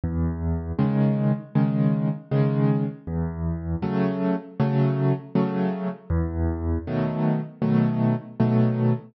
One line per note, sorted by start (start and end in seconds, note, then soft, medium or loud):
0.04 0.72 E2 medium
0.79 1.32 C#3 medium
0.79 1.32 D#3 medium
0.79 1.32 G#3 medium
1.55 2.08 C#3 medium
1.55 2.08 D#3 medium
1.55 2.08 G#3 medium
2.31 2.84 C#3 medium
2.31 2.84 D#3 medium
2.31 2.84 G#3 medium
3.07 3.76 E2 medium
3.82 4.35 C#3 medium
3.82 4.35 F#3 medium
3.82 4.35 A3 medium
4.60 5.13 C#3 medium
4.60 5.13 F#3 medium
4.60 5.13 A3 medium
5.35 5.88 C#3 medium
5.35 5.88 F#3 medium
5.35 5.88 A3 medium
6.10 6.78 E2 loud
6.87 7.40 B2 medium
6.87 7.40 D#3 medium
6.87 7.40 F#3 medium
6.87 7.40 A3 medium
7.62 8.15 B2 medium
7.62 8.15 D#3 medium
7.62 8.15 F#3 medium
7.62 8.15 A3 medium
8.40 8.93 B2 medium
8.40 8.93 D#3 medium
8.40 8.93 F#3 medium
8.40 8.93 A3 medium